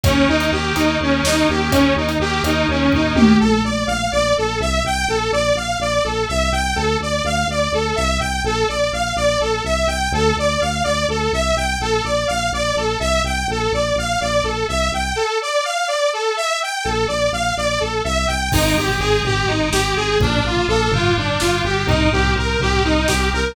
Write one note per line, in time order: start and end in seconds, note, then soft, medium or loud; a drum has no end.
0.04 0.26 D#2 medium
0.04 0.48 A#3 medium
0.04 0.48 C#4 medium
0.04 0.26 C#4 medium
0.04 0.48 D#4 medium
0.04 0.48 G4 medium
0.04 kick loud
0.04 closed hi-hat loud
0.28 0.49 D#2 medium
0.28 0.50 D#4 medium
0.40 closed hi-hat medium
0.52 0.72 D#2 medium
0.52 2.06 A#3 medium
0.52 2.06 C#4 medium
0.52 2.06 D#4 medium
0.52 2.06 G4 medium
0.52 0.75 G4 medium
0.75 0.97 D#2 medium
0.75 0.97 D#4 medium
0.75 closed hi-hat medium
1.00 1.21 D#2 medium
1.00 1.24 C#4 medium
1.23 1.44 D#2 medium
1.23 1.47 D#4 medium
1.23 snare loud
1.49 1.70 D#2 medium
1.49 1.71 G4 medium
1.71 1.93 D#2 medium
1.71 1.93 C#4 medium
1.71 kick medium
1.71 closed hi-hat loud
1.96 2.17 D#2 medium
1.96 2.18 D#4 medium
2.09 closed hi-hat medium
2.19 2.40 D#2 medium
2.19 3.31 A#3 medium
2.19 3.31 C#4 medium
2.19 3.31 D#4 medium
2.19 2.43 G4 medium
2.19 3.31 G4 medium
2.43 2.64 D#2 medium
2.43 2.67 D#4 medium
2.43 closed hi-hat medium
2.68 2.89 D#2 medium
2.68 2.92 C#4 medium
2.92 3.13 D#2 medium
2.92 3.16 D#4 medium
2.92 kick medium
2.92 floor tom medium
3.15 3.36 D#2 medium
3.15 3.37 G4 medium
3.15 high tom loud
3.40 3.62 A#1 medium
3.40 3.62 A4 medium
3.64 3.84 A#1 medium
3.64 3.86 D5 medium
3.87 4.08 A#1 medium
3.87 4.09 F5 medium
4.12 4.33 A#1 medium
4.12 4.34 D5 medium
4.37 4.58 A#1 medium
4.37 4.59 A4 medium
4.60 4.80 C2 medium
4.60 4.83 E5 medium
4.85 5.05 C2 medium
4.85 5.08 G5 medium
5.08 5.29 A#1 medium
5.08 5.31 A4 medium
5.32 5.53 A#1 medium
5.32 5.54 D5 medium
5.55 5.76 A#1 medium
5.55 5.78 F5 medium
5.79 6.00 A#1 medium
5.79 6.03 D5 medium
6.04 6.25 A#1 medium
6.04 6.26 A4 medium
6.28 6.50 C2 medium
6.28 6.50 E5 medium
6.52 6.73 C2 medium
6.52 6.74 G5 medium
6.75 6.97 D2 medium
6.75 6.97 A4 medium
7.00 7.21 D2 medium
7.00 7.24 D5 medium
7.24 7.45 D2 medium
7.24 7.47 F5 medium
7.48 7.68 D2 medium
7.48 7.72 D5 medium
7.72 7.93 D2 medium
7.72 7.96 A4 medium
7.95 8.18 C2 medium
7.95 8.18 E5 medium
8.20 8.40 C2 medium
8.20 8.42 G5 medium
8.44 8.64 A#1 medium
8.44 8.67 A4 medium
8.68 8.90 A#1 medium
8.68 8.90 D5 medium
8.93 9.13 A#1 medium
8.93 9.15 F5 medium
9.16 9.37 A#1 medium
9.16 9.38 D5 medium
9.40 9.61 A#1 medium
9.40 9.62 A4 medium
9.64 9.85 C2 medium
9.64 9.87 E5 medium
9.87 10.08 C2 medium
9.87 10.10 G5 medium
10.12 10.32 D2 medium
10.12 10.35 A4 medium
10.37 10.57 D2 medium
10.37 10.60 D5 medium
10.61 10.82 D2 medium
10.61 10.83 F5 medium
10.84 11.05 D2 medium
10.84 11.06 D5 medium
11.08 11.29 D2 medium
11.08 11.31 A4 medium
11.32 11.53 C2 medium
11.32 11.55 E5 medium
11.56 11.77 C2 medium
11.56 11.78 G5 medium
11.80 12.01 A#1 medium
11.80 12.03 A4 medium
12.04 12.25 A#1 medium
12.04 12.26 D5 medium
12.27 12.50 A#1 medium
12.27 12.49 F5 medium
12.52 12.73 A#1 medium
12.52 12.75 D5 medium
12.76 12.96 A#1 medium
12.76 12.99 A4 medium
13.00 13.20 C2 medium
13.00 13.22 E5 medium
13.23 13.44 C2 medium
13.23 13.47 G5 medium
13.48 13.68 A#1 medium
13.48 13.72 A4 medium
13.72 13.93 A#1 medium
13.72 13.95 D5 medium
13.96 14.16 A#1 medium
13.96 14.20 F5 medium
14.21 14.41 A#1 medium
14.21 14.43 D5 medium
14.44 14.64 A#1 medium
14.44 14.66 A4 medium
14.68 14.89 C2 medium
14.68 14.90 E5 medium
14.92 15.12 C2 medium
14.92 15.15 G5 medium
15.16 15.38 A4 medium
15.42 15.64 D5 medium
15.64 15.86 F5 medium
15.88 16.10 D5 medium
16.13 16.35 A4 medium
16.37 16.59 E5 medium
16.62 16.84 G5 medium
16.84 17.06 A#1 medium
16.84 17.06 A4 medium
17.08 17.29 A#1 medium
17.08 17.30 D5 medium
17.32 17.52 A#1 medium
17.32 17.54 F5 medium
17.57 17.78 A#1 medium
17.57 17.79 D5 medium
17.80 18.01 A#1 medium
17.80 18.02 A4 medium
18.04 18.26 C2 medium
18.04 18.26 E5 medium
18.27 18.49 C2 medium
18.27 18.50 G5 medium
18.52 18.74 G#1 loud
18.52 18.97 C4 medium
18.52 18.75 D#4 medium
18.52 18.97 D#4 medium
18.52 18.97 G4 medium
18.52 18.97 G#4 medium
18.52 kick loud
18.52 crash loud
18.77 18.97 G#1 medium
18.77 18.99 G4 medium
18.89 floor tom medium
18.99 19.20 G#1 medium
18.99 19.23 C4 medium
18.99 19.23 D#4 medium
18.99 19.23 G4 medium
18.99 19.21 G#4 medium
18.99 19.23 G#4 medium
19.24 19.44 G#1 medium
19.24 19.46 C4 medium
19.24 19.46 D#4 medium
19.24 19.46 G4 medium
19.24 19.48 G4 medium
19.24 19.46 G#4 medium
19.24 floor tom medium
19.48 19.70 G#1 medium
19.48 19.70 C4 medium
19.48 19.70 D#4 medium
19.48 19.70 G4 medium
19.48 19.70 G#4 medium
19.72 19.93 G#1 medium
19.72 20.16 C4 medium
19.72 20.16 D#4 medium
19.72 20.16 G4 medium
19.72 19.95 G4 medium
19.72 20.16 G#4 medium
19.72 snare loud
19.96 20.17 G#1 medium
19.96 20.18 G#4 medium
20.20 20.40 A#1 loud
20.20 20.66 A#3 medium
20.20 20.66 D4 medium
20.20 20.44 D4 medium
20.20 20.66 F4 medium
20.20 20.66 A4 medium
20.20 kick loud
20.20 floor tom medium
20.44 20.64 A#1 medium
20.44 20.68 F4 medium
20.57 floor tom medium
20.68 20.89 A#1 loud
20.68 20.91 A#3 medium
20.68 20.91 D4 medium
20.68 20.91 F4 medium
20.68 20.90 A4 medium
20.68 20.91 A4 medium
20.91 21.11 G1 loud
20.91 21.14 B3 medium
20.91 21.14 D4 medium
20.91 21.14 F4 medium
20.91 21.16 F4 medium
20.91 21.14 G4 medium
20.91 floor tom loud
21.16 21.36 G1 medium
21.16 21.39 B3 medium
21.16 21.39 D4 medium
21.16 21.40 D4 medium
21.16 21.39 F4 medium
21.16 21.39 G4 medium
21.40 21.62 G1 medium
21.40 21.84 B3 medium
21.40 21.84 D4 medium
21.40 21.84 F4 medium
21.40 21.62 F4 medium
21.40 21.84 G4 medium
21.40 snare medium
21.64 21.85 G1 medium
21.64 21.87 G4 medium
21.87 22.07 C2 loud
21.87 22.32 A#3 medium
21.87 22.32 C4 medium
21.87 22.09 D#4 medium
21.87 22.32 D#4 medium
21.87 22.32 G4 medium
21.87 kick loud
21.87 floor tom loud
22.12 22.34 C2 loud
22.12 22.34 G4 medium
22.24 floor tom medium
22.36 22.56 C2 medium
22.36 22.59 A#3 medium
22.36 22.59 C4 medium
22.36 22.59 D#4 medium
22.36 22.59 G4 medium
22.36 22.60 A#4 medium
22.60 22.80 C2 medium
22.60 22.83 A#3 medium
22.60 22.83 C4 medium
22.60 22.83 D#4 medium
22.60 22.83 G4 medium
22.60 floor tom medium
22.84 23.05 C2 medium
22.84 23.07 A#3 medium
22.84 23.07 C4 medium
22.84 23.07 D#4 medium
22.84 23.07 G4 medium
23.07 23.30 C2 medium
23.07 23.53 A#3 medium
23.07 23.53 C4 medium
23.07 23.53 D#4 medium
23.07 23.30 G4 medium
23.07 23.53 G4 medium
23.07 snare loud
23.33 23.53 C2 medium
23.33 23.55 A#4 medium